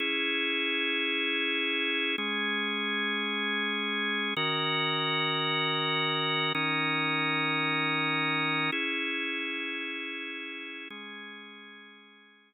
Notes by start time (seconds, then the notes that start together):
0.00 C#4 E4 G#4
2.18 G#3 C#4 G#4
4.37 D#3 C#4 F#4 A#4
6.55 D#3 C#4 D#4 A#4
8.72 C#4 E4 G#4
10.90 G#3 C#4 G#4